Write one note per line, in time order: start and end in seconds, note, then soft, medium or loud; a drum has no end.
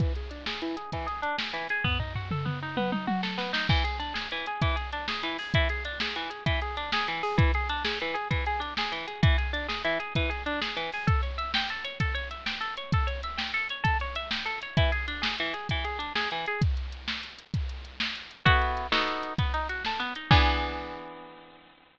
0.00 0.13 E3 medium
0.00 kick medium
0.00 closed hi-hat medium
0.15 0.30 G#4 medium
0.15 closed hi-hat medium
0.31 0.45 D4 medium
0.31 closed hi-hat medium
0.46 0.61 G#4 medium
0.46 snare medium
0.62 0.76 E3 medium
0.62 closed hi-hat medium
0.77 0.91 G#4 medium
0.77 closed hi-hat medium
0.92 1.07 E3 medium
0.92 kick medium
0.92 closed hi-hat medium
1.07 1.21 G#4 medium
1.07 closed hi-hat medium
1.22 1.36 D4 medium
1.22 closed hi-hat medium
1.38 1.52 G#4 soft
1.38 snare medium
1.53 1.67 E3 medium
1.53 closed hi-hat medium
1.69 1.84 G#4 medium
1.69 closed hi-hat medium
1.84 1.98 B3 medium
1.84 kick medium
1.84 floor tom medium
2.00 2.13 D#4 soft
2.00 floor tom medium
2.15 2.29 F#4 medium
2.15 floor tom medium
2.31 2.45 A4 medium
2.31 mid tom medium
2.45 2.59 B3 medium
2.45 mid tom medium
2.62 2.76 D#4 medium
2.77 2.91 B3 medium
2.77 high tom medium
2.92 3.06 D#4 medium
2.92 high tom medium
3.07 3.21 F#4 medium
3.07 high tom medium
3.23 3.37 A4 medium
3.23 snare medium
3.38 3.51 B3 medium
3.38 snare medium
3.53 3.67 D#4 medium
3.53 snare loud
3.69 3.83 E3 medium
3.69 kick medium
3.69 crash medium
3.84 3.98 G#4 medium
3.84 closed hi-hat medium
4.00 4.13 D4 medium
4.00 closed hi-hat medium
4.14 4.28 G#4 medium
4.14 snare medium
4.31 4.46 E3 medium
4.31 closed hi-hat medium
4.46 4.61 G#4 medium
4.46 closed hi-hat medium
4.62 4.76 E3 medium
4.62 kick medium
4.62 closed hi-hat medium
4.76 4.90 G#4 medium
4.76 closed hi-hat medium
4.92 5.07 D4 medium
4.92 closed hi-hat medium
5.08 5.22 G#4 medium
5.08 snare medium
5.23 5.37 E3 medium
5.23 closed hi-hat medium
5.38 5.53 G#4 medium
5.38 open hi-hat medium
5.54 5.68 E3 medium
5.54 kick medium
5.54 closed hi-hat loud
5.69 5.84 G#4 medium
5.69 closed hi-hat medium
5.85 5.99 D4 medium
5.85 closed hi-hat medium
6.00 6.15 G#4 medium
6.00 snare loud
6.15 6.30 E3 medium
6.15 closed hi-hat medium
6.30 6.44 G#4 medium
6.30 closed hi-hat medium
6.46 6.60 E3 medium
6.46 kick medium
6.46 closed hi-hat medium
6.61 6.76 G#4 medium
6.61 closed hi-hat medium
6.77 6.91 D4 medium
6.77 closed hi-hat medium
6.92 7.07 G#4 medium
6.92 snare loud
7.08 7.22 E3 medium
7.08 closed hi-hat medium
7.23 7.37 G#4 medium
7.23 open hi-hat medium
7.38 7.52 E3 medium
7.38 kick loud
7.38 closed hi-hat loud
7.54 7.68 G#4 medium
7.54 closed hi-hat medium
7.69 7.83 D4 medium
7.69 closed hi-hat medium
7.85 7.98 G#4 medium
7.85 snare loud
8.00 8.15 E3 medium
8.00 closed hi-hat medium
8.14 8.28 G#4 medium
8.14 closed hi-hat medium
8.31 8.44 E3 medium
8.31 kick medium
8.31 closed hi-hat medium
8.46 8.60 G#4 medium
8.46 closed hi-hat medium
8.60 8.74 D4 medium
8.60 closed hi-hat medium
8.77 8.92 G#4 medium
8.77 snare loud
8.92 9.06 E3 medium
8.92 closed hi-hat medium
9.07 9.21 G#4 medium
9.07 closed hi-hat medium
9.23 9.36 E3 medium
9.23 kick loud
9.23 closed hi-hat loud
9.38 9.52 G#4 medium
9.38 closed hi-hat medium
9.53 9.67 D4 medium
9.53 closed hi-hat medium
9.68 9.82 G#4 medium
9.68 snare medium
9.84 9.98 E3 medium
9.84 closed hi-hat medium
10.00 10.13 G#4 medium
10.00 closed hi-hat medium
10.15 10.30 E3 medium
10.15 kick medium
10.15 closed hi-hat medium
10.30 10.43 G#4 medium
10.30 closed hi-hat medium
10.46 10.60 D4 medium
10.46 closed hi-hat medium
10.61 10.75 G#4 medium
10.61 snare medium
10.77 10.90 E3 medium
10.77 closed hi-hat medium
10.92 11.07 G#4 medium
10.92 open hi-hat medium
11.07 11.21 A4 medium
11.07 kick medium
11.07 closed hi-hat medium
11.23 11.36 C#5 medium
11.23 closed hi-hat medium
11.38 11.52 E5 medium
11.38 closed hi-hat medium
11.54 11.68 G5 medium
11.54 snare loud
11.69 11.84 A4 medium
11.69 closed hi-hat medium
11.84 11.98 C#5 medium
11.84 closed hi-hat medium
12.00 12.14 A4 medium
12.00 kick medium
12.00 closed hi-hat loud
12.15 12.28 C#5 medium
12.15 closed hi-hat medium
12.31 12.45 E5 medium
12.31 closed hi-hat medium
12.46 12.60 G5 medium
12.46 snare medium
12.61 12.75 A4 medium
12.61 closed hi-hat medium
12.77 12.91 C#5 medium
12.77 closed hi-hat medium
12.92 13.07 A4 medium
12.92 kick medium
12.92 closed hi-hat loud
13.07 13.21 C#5 medium
13.07 closed hi-hat medium
13.23 13.37 E5 medium
13.23 closed hi-hat medium
13.37 13.51 G5 medium
13.37 snare medium
13.54 13.68 A4 medium
13.54 closed hi-hat medium
13.69 13.84 C#5 medium
13.69 closed hi-hat medium
13.84 13.97 A4 medium
13.84 kick medium
13.84 closed hi-hat loud
14.00 14.15 C#5 medium
14.00 closed hi-hat medium
14.15 14.30 E5 medium
14.15 closed hi-hat medium
14.31 14.45 G5 medium
14.31 snare loud
14.46 14.59 A4 medium
14.46 closed hi-hat medium
14.62 14.76 C#5 medium
14.62 closed hi-hat medium
14.77 14.91 E3 medium
14.77 kick medium
14.77 closed hi-hat loud
14.92 15.06 G#4 medium
14.92 closed hi-hat medium
15.08 15.22 D4 medium
15.08 closed hi-hat medium
15.22 15.36 G#4 medium
15.22 snare loud
15.38 15.54 E3 medium
15.38 closed hi-hat medium
15.54 15.68 G#4 medium
15.54 closed hi-hat medium
15.69 15.85 E3 medium
15.69 kick medium
15.69 closed hi-hat medium
15.84 15.98 G#4 medium
15.84 closed hi-hat medium
15.99 16.13 D4 medium
15.99 closed hi-hat medium
16.15 16.29 G#4 medium
16.15 snare medium
16.31 16.46 E3 medium
16.31 closed hi-hat medium
16.46 16.61 G#4 medium
16.46 closed hi-hat medium
16.61 kick medium
16.61 closed hi-hat loud
16.77 closed hi-hat medium
16.92 closed hi-hat medium
17.08 snare medium
17.23 closed hi-hat medium
17.39 closed hi-hat medium
17.54 kick medium
17.54 closed hi-hat medium
17.69 closed hi-hat medium
17.85 closed hi-hat medium
18.00 snare loud
18.15 closed hi-hat medium
18.31 closed hi-hat medium
18.45 18.87 B3 medium
18.45 18.87 E4 medium
18.45 18.87 F#4 medium
18.45 18.87 A4 medium
18.45 kick medium
18.45 closed hi-hat medium
18.62 closed hi-hat medium
18.77 closed hi-hat medium
18.92 19.33 B3 medium
18.92 19.33 D#4 medium
18.92 19.33 F#4 medium
18.92 19.33 A4 medium
18.92 snare loud
19.08 closed hi-hat medium
19.23 closed hi-hat medium
19.38 19.52 B3 medium
19.38 kick medium
19.38 closed hi-hat medium
19.54 19.67 D#4 medium
19.54 closed hi-hat medium
19.69 19.83 F#4 medium
19.69 closed hi-hat medium
19.85 20.00 A4 medium
19.85 snare medium
20.00 20.13 B3 medium
20.00 closed hi-hat medium
20.15 20.30 D#4 medium
20.15 closed hi-hat medium
20.31 21.99 E3 loud
20.31 21.99 B3 medium
20.31 21.99 D4 loud
20.31 21.99 G#4 medium
20.31 kick loud
20.31 crash loud